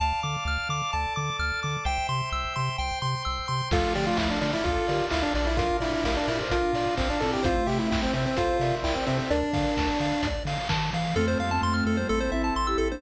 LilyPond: <<
  \new Staff \with { instrumentName = "Lead 1 (square)" } { \time 4/4 \key d \minor \tempo 4 = 129 r1 | r1 | f'8 g'16 f'16 e'16 d'16 d'16 e'16 f'4 e'16 d'16 d'16 e'16 | f'8 e'16 e'16 e'16 d'16 e'16 r16 f'4 c'16 d'16 a'16 g'16 |
f'8 g'16 e'16 e'16 c'16 c'16 c'16 f'4 e'16 c'16 c'16 c'16 | d'2~ d'8 r4. | \key f \major r1 | }
  \new Staff \with { instrumentName = "Ocarina" } { \time 4/4 \key d \minor r1 | r1 | <f a>2 <f' a'>8 <g' bes'>4 <f' a'>8 | <d' f'>4 <g' bes'>8 <g' bes'>16 <a' c''>16 <d' f'>8 <d' f'>4 <c' e'>8 |
<a c'>2 <a' c''>8 <bes' d''>4 <a' c''>8 | <bes' d''>4. r2 r8 | \key f \major <a c'>8 <g bes>16 <a c'>8. <a c'>16 <g bes>16 <a c'>8 <c' e'>8 r16 <e' g'>8 <bes d'>16 | }
  \new Staff \with { instrumentName = "Lead 1 (square)" } { \time 4/4 \key d \minor a''8 d'''8 f'''8 d'''8 a''8 d'''8 f'''8 d'''8 | g''8 c'''8 e'''8 c'''8 g''8 c'''8 e'''8 c'''8 | a'8 d''8 f''8 d''8 a'8 d''8 f''8 d''8 | bes'8 d''8 f''8 d''8 bes'8 d''8 f''8 d''8 |
c''8 e''8 g''8 e''8 c''8 e''8 g''8 e''8 | d''8 f''8 a''8 f''8 d''8 f''8 a''8 f''8 | \key f \major a'16 c''16 f''16 a''16 c'''16 f'''16 a'16 c''16 a'16 c''16 e''16 a''16 c'''16 e'''16 a'16 c''16 | }
  \new Staff \with { instrumentName = "Synth Bass 1" } { \clef bass \time 4/4 \key d \minor d,8 d8 d,8 d8 d,8 d8 d,8 d8 | c,8 c8 c,8 c8 c,8 c8 c,8 c8 | d,8 d8 d,8 d8 d,8 d8 d,8 bes,,8~ | bes,,8 bes,8 bes,,8 bes,8 bes,,8 bes,8 bes,,8 bes,8 |
c,8 c8 c,8 c8 c,8 c8 c,8 c8 | d,8 d8 d,8 d8 d,8 d8 ees8 e8 | \key f \major f,8 f,8 f,8 f,8 a,,8 a,,8 a,,8 a,,8 | }
  \new Staff \with { instrumentName = "Drawbar Organ" } { \time 4/4 \key d \minor <d'' f'' a''>2 <a' d'' a''>2 | <c'' e'' g''>2 <c'' g'' c'''>2 | <d' f' a'>1 | <d' f' bes'>1 |
<c' e' g'>1 | r1 | \key f \major <c' f' a'>2 <c' e' a'>2 | }
  \new DrumStaff \with { instrumentName = "Drums" } \drummode { \time 4/4 r4 r4 r4 r4 | r4 r4 r4 r4 | <cymc bd>8 hho8 <bd sn>8 hho8 <hh bd>8 hho8 <hc bd>8 hho8 | <hh bd>8 hho8 <bd sn>8 hho8 <hh bd>8 hho8 <hc bd>8 hho8 |
<hh bd>8 hho8 <bd sn>8 hho8 <hh bd>8 hho8 <hc bd>8 hho8 | hh8 <hho bd>8 <bd sn>8 hho8 <hh bd>8 hho8 <hc bd>8 hho8 | r4 r4 r4 r4 | }
>>